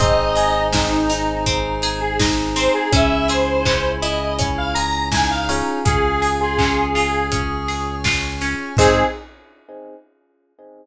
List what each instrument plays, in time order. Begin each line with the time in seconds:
0.00 synth bass 1 G#1, acoustic guitar (steel) C4, electric piano 1 C4 D#4 G#4, clarinet D#4, pad 5 (bowed) C5 D#5 G#5, lead 1 (square) D#5, kick, closed hi-hat
0.36 acoustic guitar (steel) G#4, open hi-hat
0.73 acoustic guitar (steel) C4, lead 1 (square) D#4, kick, snare
1.09 acoustic guitar (steel) D#4, open hi-hat
1.46 acoustic guitar (steel) C4, pad 5 (bowed) G#4 C5 G#5, kick, closed hi-hat
1.82 acoustic guitar (steel) G#4, open hi-hat
2.01 lead 1 (square) G#4
2.20 acoustic guitar (steel) D#4, clarinet D#4, kick, snare
2.56 acoustic guitar (steel) C4, lead 1 (square) C5, open hi-hat
2.74 lead 1 (square) G#4
2.91 synth bass 1 C#2, electric piano 1 C#4 E4 G#4, acoustic guitar (steel) C#4, clarinet E4, pad 5 (bowed) C#5 E5 G#5, lead 1 (square) E5, kick, closed hi-hat
3.28 acoustic guitar (steel) G#4, lead 1 (square) C5, open hi-hat
3.65 acoustic guitar (steel) C#4, kick, clap
4.02 acoustic guitar (steel) E4, lead 1 (square) D#5, open hi-hat
4.39 acoustic guitar (steel) C#4, pad 5 (bowed) G#4 C#5 G#5, kick, closed hi-hat
4.58 lead 1 (square) F5
4.75 acoustic guitar (steel) G#4, lead 1 (square) A#5, open hi-hat
5.11 clarinet D#4, acoustic guitar (steel) E4, lead 1 (square) G#5, kick, snare
5.31 lead 1 (square) F5
5.49 acoustic guitar (steel) C#4, electric piano 1 C#4 F4 G#4, open hi-hat
5.85 synth bass 1 C#2, acoustic guitar (steel) C#4, clarinet G#4, lead 1 (square) G#4, pad 5 (bowed) C#5 F5 G#5, kick, closed hi-hat
6.22 acoustic guitar (steel) G#4, open hi-hat
6.40 clarinet F4, lead 1 (square) G#4
6.59 acoustic guitar (steel) C#4, kick, clap
6.94 acoustic guitar (steel) F4, clarinet G#4, open hi-hat
7.32 acoustic guitar (steel) C#4, pad 5 (bowed) C#5 G#5 C#6, kick, closed hi-hat
7.68 acoustic guitar (steel) G#4, open hi-hat
8.04 acoustic guitar (steel) F4, kick, snare
8.41 acoustic guitar (steel) C#4, open hi-hat
8.77 synth bass 1 G#2, acoustic guitar (steel) C4 D#4, pad 5 (bowed) C4 D#4 G#4, electric piano 1 C4 D#4 G#4, clarinet G#4, lead 1 (square) G#4, kick, crash
8.81 acoustic guitar (steel) G#4